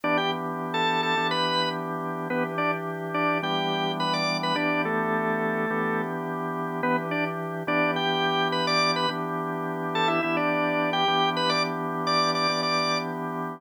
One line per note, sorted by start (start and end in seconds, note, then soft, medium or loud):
0.04 1.15 E3 medium
0.04 1.15 B3 medium
0.04 1.15 D4 medium
0.04 0.17 D4 medium
0.04 1.15 G4 medium
0.04 0.17 D5 medium
0.17 0.31 G4 medium
0.17 0.31 G5 medium
0.74 1.01 A4 medium
0.74 1.01 A5 medium
1.03 1.27 A4 medium
1.03 1.27 A5 medium
1.17 2.28 E3 medium
1.17 2.28 B3 medium
1.17 2.28 D4 medium
1.17 2.28 G4 medium
1.31 1.69 B4 medium
1.31 1.69 B5 medium
2.30 3.41 E3 medium
2.30 2.44 B3 medium
2.30 3.41 D4 medium
2.30 3.41 G4 loud
2.30 2.44 B4 medium
2.58 2.71 D4 medium
2.58 2.71 D5 medium
3.14 3.38 D4 medium
3.14 3.38 D5 medium
3.43 4.54 E3 loud
3.43 4.54 G3 medium
3.43 4.54 B3 medium
3.43 4.54 D4 medium
3.43 3.92 G4 medium
3.43 3.92 G5 medium
4.00 4.13 B4 medium
4.00 4.13 B5 medium
4.14 4.37 D5 medium
4.14 4.37 D6 medium
4.43 4.57 B4 medium
4.43 4.57 B5 medium
4.55 5.66 E3 medium
4.55 5.66 B3 medium
4.55 5.66 D4 medium
4.55 4.82 D4 medium
4.55 5.66 G4 medium
4.55 4.82 D5 medium
4.85 6.02 A3 medium
4.85 6.02 A4 medium
5.70 6.81 E3 medium
5.70 6.81 B3 medium
5.70 6.81 D4 medium
5.70 6.81 G4 loud
6.83 7.63 E3 loud
6.83 6.96 B3 medium
6.83 7.63 D4 medium
6.83 7.63 G4 medium
6.83 6.96 B4 medium
7.11 7.25 D4 medium
7.11 7.25 D5 medium
7.67 9.06 E3 medium
7.67 9.06 B3 medium
7.67 9.06 D4 medium
7.67 7.91 D4 medium
7.67 9.06 G4 loud
7.67 7.91 D5 medium
7.96 8.48 G4 medium
7.96 8.48 G5 medium
8.52 8.66 B4 medium
8.52 8.66 B5 medium
8.67 8.91 D5 medium
8.67 8.91 D6 medium
8.96 9.09 B4 medium
8.96 9.09 B5 medium
9.09 10.20 E3 medium
9.09 10.20 B3 medium
9.09 10.20 D4 loud
9.09 10.20 G4 loud
9.95 10.08 A4 medium
9.95 10.08 A5 medium
10.08 10.21 E4 medium
10.08 10.21 E5 medium
10.23 11.05 E3 medium
10.23 11.05 B3 medium
10.23 11.05 D4 medium
10.23 10.36 E4 medium
10.23 11.05 G4 medium
10.23 10.36 E5 medium
10.37 10.90 D4 medium
10.37 10.90 D5 medium
10.93 11.29 G4 medium
10.93 11.29 G5 medium
11.08 12.47 E3 medium
11.08 12.47 B3 medium
11.08 12.47 D4 medium
11.08 12.47 G4 medium
11.37 11.50 B4 medium
11.37 11.50 B5 medium
11.50 11.63 D5 medium
11.50 11.63 D6 medium
12.07 12.31 D5 medium
12.07 12.31 D6 medium
12.35 12.61 D5 medium
12.35 12.61 D6 medium
12.49 13.60 E3 medium
12.49 13.60 B3 medium
12.49 13.60 D4 medium
12.49 13.60 G4 medium
12.63 12.98 D5 medium
12.63 12.98 D6 medium